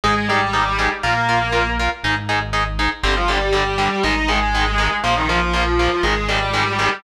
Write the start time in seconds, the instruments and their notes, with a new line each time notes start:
0.04 synth bass 1 G#1, distortion guitar G#3 G#4, overdriven guitar D#4 G#4
0.28 distortion guitar G3 G4, overdriven guitar D#4 G#4
0.53 overdriven guitar D#4 G#4
0.79 overdriven guitar D#4 G#4
1.03 synth bass 1 A#1, distortion guitar A#3 A#4, overdriven guitar F4 A#4
1.29 overdriven guitar F4 A#4
1.52 overdriven guitar F4 A#4
1.79 overdriven guitar F4 A#4
2.03 synth bass 1 G#1, overdriven guitar D#4 G#4
2.29 overdriven guitar D#4 G#4
2.53 overdriven guitar D#4 G#4
2.79 overdriven guitar D#4 G#4
3.03 synth bass 1 G1, overdriven guitar D3 G3, distortion guitar C4 C5
3.16 distortion guitar F3 F4
3.28 overdriven guitar D3 G3, distortion guitar G3 G4
3.53 overdriven guitar D3 G3, distortion guitar G3 G4
3.78 overdriven guitar D3 G3
4.03 synth bass 1 G#1, overdriven guitar D#3 G#3, distortion guitar D#4 D#5
4.28 overdriven guitar D#3 G#3, distortion guitar G#3 G#4
4.55 overdriven guitar D#3 G#3
4.78 overdriven guitar D#3 G#3
5.04 synth bass 1 A#1, distortion guitar F3 F4, overdriven guitar F3 A#3
5.16 distortion guitar D#3 D#4
5.28 distortion guitar F3 F4, overdriven guitar F3 A#3
5.53 distortion guitar F3 F4, overdriven guitar F3 A#3
5.79 overdriven guitar F3 A#3
6.03 synth bass 1 G#1, overdriven guitar D#3 G#3, distortion guitar G#3 G#4
6.28 overdriven guitar D#3 G#3, distortion guitar G3 G4
6.54 overdriven guitar D#3 G#3
6.79 overdriven guitar D#3 G#3